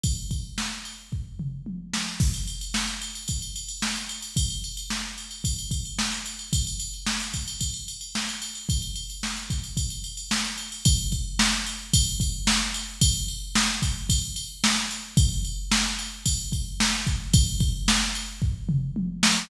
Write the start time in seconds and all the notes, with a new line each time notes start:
0.03 kick, ride
0.31 kick, ride
0.58 snare
0.85 ride
1.12 kick, floor tom
1.39 mid tom
1.66 high tom
1.93 snare
2.20 kick, crash
2.34 ride
2.47 ride
2.61 ride
2.74 snare
2.88 ride
3.01 ride
3.15 ride
3.28 kick, ride
3.42 ride
3.56 ride
3.68 ride
3.82 snare
3.96 ride
4.09 ride
4.22 ride
4.36 kick, ride
4.50 ride
4.64 ride
4.77 ride
4.90 snare
5.18 ride
5.31 ride
5.44 kick, ride
5.59 ride
5.71 kick, ride
5.85 ride
5.99 snare
6.12 ride
6.25 ride
6.39 ride
6.53 kick, ride
6.67 ride
6.80 ride
6.94 ride
7.06 snare
7.20 ride
7.33 kick, ride
7.48 ride
7.60 kick, ride
7.74 ride
7.88 ride
8.01 ride
8.15 snare
8.29 ride
8.42 ride
8.55 ride
8.69 kick, ride
8.82 ride
8.95 ride
9.10 ride
9.23 snare
9.36 ride
9.50 kick, ride
9.64 ride
9.77 kick, ride
9.90 ride
10.04 ride
10.17 ride
10.31 snare
10.44 ride
10.58 ride
10.72 ride
10.85 kick, ride
11.12 kick, ride
11.39 snare
11.66 ride
11.93 kick, ride
12.20 kick, ride
12.47 snare
12.74 ride
13.01 kick, ride
13.28 ride
13.55 snare
13.82 kick, ride
14.09 kick, ride
14.36 ride
14.64 snare
14.91 ride
15.17 kick, ride
15.45 ride
15.71 snare
15.99 ride
16.26 kick, ride
16.52 kick, ride
16.80 snare
17.07 kick, ride
17.33 kick, ride
17.60 kick, ride
17.88 snare
18.15 ride
18.42 kick, floor tom
18.69 mid tom
18.96 high tom
19.23 snare